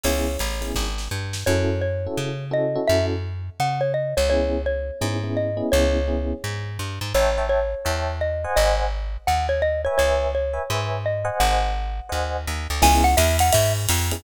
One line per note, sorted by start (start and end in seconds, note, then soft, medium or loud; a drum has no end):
0.03 0.37 C#2 medium
0.03 0.32 B3 loud
0.03 0.32 C#4 medium
0.03 0.32 E4 loud
0.03 0.32 G#4 loud
0.03 0.69 C#5 medium
0.03 ride loud
0.39 0.73 A1 medium
0.39 kick medium
0.39 hi-hat pedal medium
0.39 ride medium
0.61 0.83 B3 medium
0.61 0.83 C#4 medium
0.61 0.83 E4 medium
0.61 0.83 G#4 medium
0.61 ride medium
0.75 1.09 G#1 medium
0.75 kick medium
0.75 snare medium
0.98 snare medium
1.11 1.44 G2 medium
1.33 snare loud
1.46 2.07 F#2 loud
1.46 1.75 C#4 loud
1.46 1.75 E4 loud
1.46 1.75 F#4 loud
1.46 1.75 A4 loud
1.46 1.81 C#5 loud
1.81 2.45 C#5 medium
2.06 2.29 C#4 medium
2.06 2.29 E4 medium
2.06 2.29 F#4 medium
2.06 2.29 A4 medium
2.17 2.78 C#3 medium
2.51 2.72 C#4 loud
2.51 2.72 E4 medium
2.51 2.72 F#4 medium
2.51 2.72 A4 loud
2.51 2.88 D#5 medium
2.75 3.16 C#4 loud
2.75 3.16 E4 medium
2.75 3.16 F#4 loud
2.75 3.16 A4 loud
2.87 3.50 F#2 medium
2.87 3.06 E5 loud
3.60 4.14 C#3 medium
3.60 3.81 F#5 loud
3.81 3.92 C#5 medium
3.94 4.15 D#5 medium
4.17 4.91 C#2 medium
4.17 4.29 C#5 medium
4.30 4.58 B3 loud
4.30 4.58 C#4 loud
4.30 4.58 E4 loud
4.30 4.58 G#4 loud
4.30 4.62 C#5 loud
4.66 5.32 C#5 medium
5.01 5.62 G#2 medium
5.01 5.17 B3 medium
5.01 5.17 C#4 medium
5.01 5.17 E4 loud
5.01 5.17 G#4 medium
5.24 5.46 B3 medium
5.24 5.46 C#4 loud
5.24 5.46 E4 medium
5.24 5.46 G#4 medium
5.37 5.69 D#5 medium
5.57 5.98 B3 loud
5.57 5.98 C#4 loud
5.57 5.98 E4 loud
5.57 5.98 G#4 loud
5.72 6.33 C#2 loud
5.72 6.70 C#5 loud
6.08 6.35 B3 loud
6.08 6.35 C#4 medium
6.08 6.35 E4 medium
6.08 6.35 G#4 medium
6.44 6.78 G#2 medium
6.79 6.99 G2 medium
7.01 7.13 G#2 medium
7.14 7.75 A1 loud
7.14 7.46 C#5 loud
7.14 7.31 C#5 loud
7.14 7.31 E5 loud
7.14 7.31 G5 loud
7.14 7.31 A5 loud
7.38 7.60 C#5 loud
7.38 7.60 E5 loud
7.38 7.60 G5 loud
7.38 7.60 A5 medium
7.49 8.14 C#5 medium
7.85 8.46 E2 medium
7.85 8.12 C#5 loud
7.85 8.12 E5 loud
7.85 8.12 G5 loud
7.85 8.12 A5 medium
8.21 8.55 D#5 medium
8.44 8.85 C5 loud
8.44 8.85 D#5 loud
8.44 8.85 F#5 loud
8.44 8.85 G#5 loud
8.56 9.17 G#1 loud
8.56 8.75 D#5 loud
9.27 9.88 D#2 medium
9.27 9.47 F#5 loud
9.49 9.62 C#5 medium
9.62 9.81 D#5 loud
9.85 10.27 B4 loud
9.85 9.97 C#5 loud
9.85 10.27 C#5 loud
9.85 10.27 E5 loud
9.85 10.27 G#5 loud
9.98 10.59 C#2 medium
9.98 10.31 C#5 loud
10.35 10.96 C#5 medium
10.53 10.63 B4 medium
10.53 10.63 C#5 medium
10.53 10.63 E5 loud
10.53 10.63 G#5 medium
10.70 11.30 G#2 medium
10.70 10.98 B4 loud
10.70 10.98 C#5 loud
10.70 10.98 E5 loud
10.70 10.98 G#5 medium
11.06 11.37 D#5 medium
11.25 11.65 C5 loud
11.25 11.65 D#5 loud
11.25 11.65 F#5 loud
11.25 11.65 G#5 loud
11.40 12.00 G#1 loud
11.40 12.44 F#5 loud
12.09 12.46 D#2 medium
12.09 12.37 C5 loud
12.09 12.37 D#5 loud
12.09 12.37 F#5 loud
12.09 12.37 G#5 medium
12.47 12.67 D#2 medium
12.70 12.82 D2 medium
12.82 13.15 C#2 loud
12.82 13.09 B3 loud
12.82 13.09 C#4 loud
12.82 13.09 E4 loud
12.82 13.09 G#4 loud
12.82 13.04 G#5 loud
12.82 kick loud
12.82 ride loud
13.04 13.16 F#5 loud
13.17 13.51 E2 loud
13.17 13.37 E5 loud
13.17 hi-hat pedal loud
13.17 ride loud
13.39 13.53 F#5 loud
13.39 ride loud
13.53 13.87 G#2 loud
13.53 13.73 E5 loud
13.53 kick medium
13.53 ride loud
13.89 14.22 F2 loud
13.89 hi-hat pedal loud
13.89 ride loud
14.11 14.21 B3 medium
14.11 14.21 C#4 medium
14.11 14.21 E4 loud
14.11 14.21 G#4 loud
14.11 ride loud